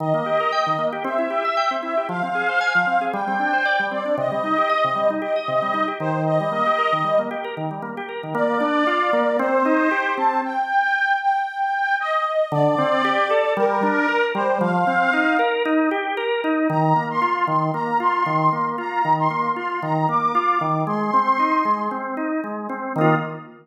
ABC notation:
X:1
M:4/4
L:1/16
Q:"Swing 16ths" 1/4=115
K:Eb
V:1 name="Accordion"
e8 =e6 e2 | f8 g6 d2 | e8 e6 c2 | e8 z8 |
[K:Bb] d8 c6 a2 | g6 g6 e4 | d8 B6 c2 | f6 z10 |
[K:Eb] b3 c'3 c'2 b2 c'6 | b3 c'3 c'2 b2 d'6 | c'8 z8 | e'4 z12 |]
V:2 name="Drawbar Organ"
E, B, G B g E, B, G C =E G =e g C E G | F, C A c a F, C A G, C D c d G, C D | C, G, E G e C, G, E G e C, G, E G E,2- | E, G, B, G B E, G, B, G B E, G, B, G B E, |
[K:Bb] B,2 D2 F2 B,2 C2 E2 G2 C2 | z16 | D,2 C2 G2 A2 G,2 D2 B2 G,2 | F,2 C2 E2 B2 E2 G2 B2 E2 |
[K:Eb] E,2 B,2 F2 E,2 B,2 F2 E,2 B,2 | F2 E,2 B,2 F2 E,2 B,2 F2 E,2 | A,2 C2 E2 A,2 C2 E2 A,2 C2 | [E,B,F]4 z12 |]